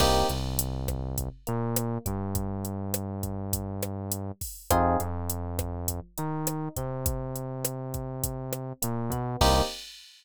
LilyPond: <<
  \new Staff \with { instrumentName = "Electric Piano 1" } { \time 4/4 \key c \minor \tempo 4 = 102 <bes c' ees' g'>8 c2 bes4 g8~ | g1 | <c' ees' f' aes'>8 f2 ees'4 c'8~ | c'2. bes8 b8 |
<bes c' ees' g'>4 r2. | }
  \new Staff \with { instrumentName = "Synth Bass 1" } { \clef bass \time 4/4 \key c \minor c,8 c,2 bes,4 g,8~ | g,1 | f,8 f,2 ees4 c8~ | c2. bes,8 b,8 |
c,4 r2. | }
  \new DrumStaff \with { instrumentName = "Drums" } \drummode { \time 4/4 <cymc bd ss>8 hh8 hh8 <hh bd ss>8 <hh bd>8 hh8 <hh ss>8 <hh bd>8 | <hh bd>8 hh8 <hh ss>8 <hh bd>8 <hh bd>8 <hh ss>8 hh8 <hho bd>8 | <hh bd ss>8 hh8 hh8 <hh bd ss>8 <hh bd>8 hh8 <hh ss>8 <hh bd>8 | <hh bd>8 hh8 <hh ss>8 <hh bd>8 <hh bd>8 <hh ss>8 hh8 <hh bd>8 |
<cymc bd>4 r4 r4 r4 | }
>>